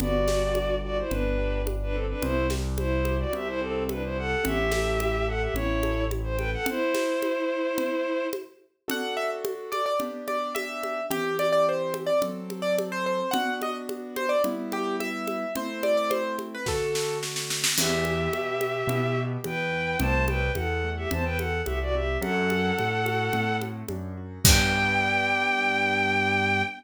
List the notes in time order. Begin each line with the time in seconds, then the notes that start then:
0.00 G1 B3 F#4 D5, low conga
0.28 G4, snare, high conga
0.55 D4, high conga
0.84 F#4 G4 D5
0.98 E4 C5
1.10 G1 B3 D4 B4, low conga
1.38 G4
1.66 D4, high conga
1.83 D4 B4
1.92 C4 G4 A4
2.09 D4 B4
2.22 C2 C4 E4 C5, low conga
2.50 G4, snare, high conga
2.77 E4 C5, high conga
3.05 G4, high conga
3.19 F#4 D5
3.33 C2 C4 G4 E5, low conga
3.47 E4 C5
3.59 C4 G4 A4
3.89 D4 E4 B4, high conga
4.04 E4 C5
4.18 G4 A4 F#5
4.43 A1 C#4 G4 E5, low conga
4.71 A4, snare, high conga
5.00 E4, high conga
5.28 A4 F#5
5.41 G4 E5
5.54 A1 C#4 E4 C#5, low conga
5.83 A4, high conga
6.11 E4, high conga
6.23 C5
6.37 A4 B4 G5, high conga
6.53 A4 F#5
6.66 E4 C5, low conga
6.95 snare, high conga
7.22 high conga
7.78 low conga
8.33 high conga
8.88 D4 F#4 A4 F#5, low conga
9.17 E5
9.45 high conga
9.72 D5, high conga
9.86 D5
10.00 B3 D4 G4, low conga
10.28 D5, high conga
10.55 E5, high conga
10.83 high conga
11.10 E3 C4 G4, low conga
11.39 D5, high conga
11.53 D5
11.69 C5
11.94 high conga
12.06 D5
12.22 F#3 C4 A4, low conga
12.50 high conga
12.62 D5
12.78 high conga
12.92 C5
13.06 C5
13.31 B3 D4 F#4 F#5, low conga
13.62 D#5, high conga
13.89 high conga
14.16 C5, high conga
14.29 D5
14.44 G3 B3 E4, low conga
14.72 G4, high conga
15.00 E5, high conga
15.27 high conga
15.56 A3 C4 E4 C5, low conga
15.83 D5, high conga
15.97 D5
16.10 C5, high conga
16.39 high conga
16.55 B4
16.66 D3 A3 F#4 A4, kick, snare
16.95 snare
17.23 snare
17.36 snare
17.50 snare
17.64 snare
17.77 E2 B3 G4 E5, crash, low conga
18.05 E4, high conga
18.33 B2 G4, high conga
18.61 B3, high conga
18.87 B2 E4, low conga
19.17 G4
19.44 E2 B3 B4 G5, high conga
19.73 E4
20.00 C2 A3 C5 A5, low conga
20.27 C4 B4 G5, high conga
20.55 E2 E4 A4 F#5, high conga
20.84 A3
20.97 G4 E5
21.11 E2 C4 C5 A5, low conga
21.24 B4 G5
21.38 E4 A4 F#5, high conga
21.66 C2 A3 G4 E5, high conga
21.81 F#4 D5
21.94 C4 G4 E5
22.21 F#2 A3 A4 F#5, high conga
22.50 C4, high conga
22.77 A2 D4, high conga
23.05 F#4, high conga
23.33 A2 A3, low conga
23.61 C4, high conga
23.88 F#2 D4, high conga
24.17 F#4
24.44 G2 B3 D4 G4 G5, kick, crash